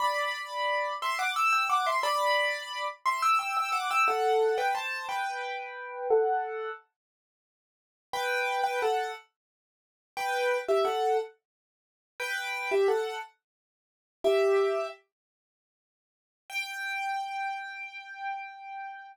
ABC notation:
X:1
M:6/8
L:1/16
Q:3/8=59
K:G
V:1 name="Acoustic Grand Piano"
[db]6 [ec'] [fd'] [ge'] [ge'] [fd'] [ec'] | [db]6 [ec'] [ge'] [ge'] [ge'] [fd'] [ge'] | [Af]3 [Bg] [ca]2 [Bg]6 | [Af]4 z8 |
[Bg]3 [Bg] [Af]2 z6 | [Bg]3 [Ge] [Af]2 z6 | [Bg]3 [Ge] [Af]2 z6 | "^rit." [Ge]4 z8 |
g12 |]